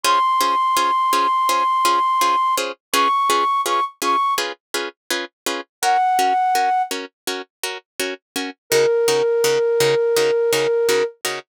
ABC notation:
X:1
M:4/4
L:1/16
Q:1/4=83
K:Db
V:1 name="Flute"
c'16 | d'4 d' z d'2 z8 | g6 z10 | B16 |]
V:2 name="Orchestral Harp"
[DFAc]2 [DFAc]2 [DFAc]2 [DFAc]2 [DFAc]2 [DFAc]2 [DFAc]2 [DFAc]2 | [DFA_c]2 [DFAc]2 [DFAc]2 [DFAc]2 [DFAc]2 [DFAc]2 [DFAc]2 [DFAc]2 | [DGB]2 [DGB]2 [DGB]2 [DGB]2 [DGB]2 [DGB]2 [DGB]2 [DGB]2 | [D,EGB]2 [D,EGB]2 [D,EGB]2 [D,EGB]2 [D,EGB]2 [D,EGB]2 [D,EGB]2 [D,EGB]2 |]